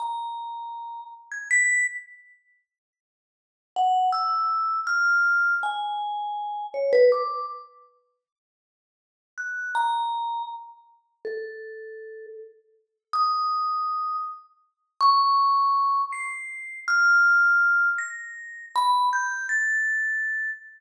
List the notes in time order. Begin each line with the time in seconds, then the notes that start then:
0.00 A#5
1.32 G#6
1.51 B6
3.76 F#5
4.12 E6
4.87 F6
5.63 G#5
6.74 C#5
6.93 B4
7.12 D6
9.38 F#6
9.75 A#5
11.25 A4
13.13 D#6
15.01 C#6
16.12 C7
16.88 F6
17.98 A#6
18.76 B5
19.13 G6
19.49 A6